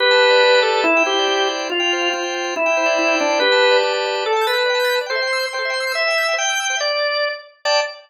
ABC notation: X:1
M:2/2
L:1/16
Q:"Swing 16ths" 1/2=141
K:Gmix
V:1 name="Drawbar Organ"
B12 A4 | E4 G8 z4 | F8 z8 | E12 D4 |
B8 z8 | [K:Dmix] A4 B12 | c8 c8 | e8 g8 |
d10 z6 | d8 z8 |]
V:2 name="Drawbar Organ"
G2 a2 B2 d2 G2 a2 d2 B2 | E2 g2 c2 d2 E2 g2 d2 c2 | F2 g2 c2 g2 F2 g2 g2 c2 | E2 g2 c2 d2 E2 g2 d2 c2 |
G2 a2 B2 d2 G2 a2 d2 B2 | [K:Dmix] d g a g' a' g' a d g a g' a' g' a d g | A e g c' e' g' e' c' g A e g c' e' g' e' | c e g e' g' e' g c e g e' g' e' g c e |
z16 | [dga]8 z8 |]